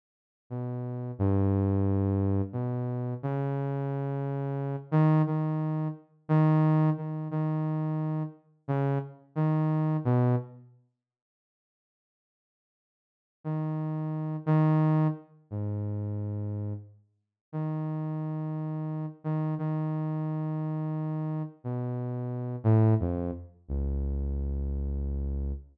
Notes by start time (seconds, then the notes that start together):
0.50 B2
1.19 G2
2.53 B2
3.23 C#3
4.91 D#3
5.27 D#3
6.29 D#3
6.97 D#3
7.31 D#3
8.68 C#3
9.36 D#3
10.05 B2
13.44 D#3
14.46 D#3
15.51 G#2
17.52 D#3
19.24 D#3
19.58 D#3
21.64 B2
22.64 A2
23.00 F2
23.68 C#2